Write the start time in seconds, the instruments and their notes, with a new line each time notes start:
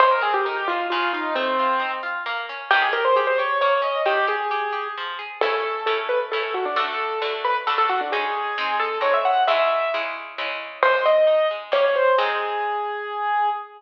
0.00 orchestral harp G#3, acoustic grand piano C5
0.11 acoustic grand piano A#4
0.21 orchestral harp C4, acoustic grand piano G#4
0.34 acoustic grand piano G4
0.45 orchestral harp D#4, acoustic grand piano A#4
0.56 acoustic grand piano G4
0.68 orchestral harp G#3, acoustic grand piano F4
0.90 orchestral harp C#3, acoustic grand piano F4
1.13 acoustic grand piano D#4, orchestral harp F4
1.35 orchestral harp A3, acoustic grand piano C4
1.59 orchestral harp F4
1.80 orchestral harp D#4
2.03 orchestral harp F4
2.26 orchestral harp A#3
2.49 orchestral harp C#4
2.71 orchestral harp D#3, acoustic grand piano G4
2.82 acoustic grand piano G#4
2.93 orchestral harp G4, acoustic grand piano A#4
3.05 acoustic grand piano C5
3.16 orchestral harp G4, acoustic grand piano G#4
3.27 acoustic grand piano C5
3.38 orchestral harp G4, acoustic grand piano C#5
3.61 orchestral harp A#3, acoustic grand piano C#5
3.82 orchestral harp C#4, acoustic grand piano D#5
4.05 orchestral harp D#3, acoustic grand piano G4
4.27 orchestral harp G4, acoustic grand piano G#4
4.51 orchestral harp G4
4.72 orchestral harp G4
4.97 orchestral harp F3
5.19 orchestral harp G#4
5.41 orchestral harp A3 C#4 E4, acoustic grand piano A4
5.86 orchestral harp A3 C#4 E4, acoustic grand piano A4
6.09 acoustic grand piano B4
6.32 orchestral harp A3 C#4 E4, acoustic grand piano A4
6.43 acoustic grand piano A4
6.54 acoustic grand piano F#4
6.65 acoustic grand piano D4
6.76 orchestral harp D3 A3 F#4, acoustic grand piano A4
7.22 orchestral harp D3 A3 F#4, acoustic grand piano A4
7.45 acoustic grand piano B4
7.67 orchestral harp D3 A3 F#4, acoustic grand piano A4
7.78 acoustic grand piano A4
7.89 acoustic grand piano F#4
8.01 acoustic grand piano D4
8.12 orchestral harp G#3 C#4 D#4, acoustic grand piano G#4
8.58 orchestral harp G#3 C4 D#4
8.80 acoustic grand piano A4
9.01 orchestral harp G#3 C4 D#4, acoustic grand piano C#5
9.14 acoustic grand piano E5
9.25 acoustic grand piano F#5
9.47 orchestral harp C#3 G#3 E4, acoustic grand piano E5
9.94 orchestral harp C#3 G#3 E4
10.38 orchestral harp C#3 G#3 E4
10.83 orchestral harp G#3, acoustic grand piano C5
11.06 orchestral harp C4, acoustic grand piano D#5
11.27 orchestral harp D#4
11.51 orchestral harp G#3
11.72 orchestral harp G3 A#3 C#4, acoustic grand piano C#5
11.84 acoustic grand piano C#5
11.95 acoustic grand piano C5
12.18 orchestral harp G#3 C4 D#4, acoustic grand piano G#4